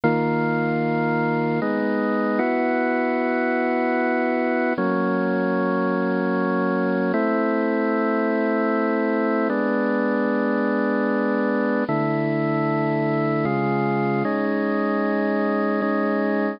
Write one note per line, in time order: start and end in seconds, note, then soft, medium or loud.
0.04 1.60 D#3 medium
0.04 1.60 A#3 medium
0.04 1.60 F4 medium
1.62 2.40 G#3 medium
1.62 2.38 B3 medium
1.62 2.40 D#4 medium
2.39 4.73 B3 medium
2.39 4.73 E4 medium
2.39 4.73 F#4 medium
4.78 7.12 F#3 medium
4.78 7.12 A#3 medium
4.78 7.12 C#4 medium
7.13 9.48 A3 medium
7.13 9.48 C4 medium
7.13 9.48 E4 medium
9.50 11.84 G#3 medium
9.50 11.84 B3 medium
9.50 11.84 D4 medium
11.88 13.45 D3 medium
11.88 13.45 A3 medium
11.88 13.45 E4 medium
13.45 14.23 C#3 medium
13.45 14.23 G#3 medium
13.45 14.23 F4 medium
14.25 15.81 G#3 medium
14.25 15.81 C#4 medium
14.25 15.81 D#4 medium
15.82 16.60 G#3 medium
15.82 16.60 C#4 medium
15.82 16.60 D#4 medium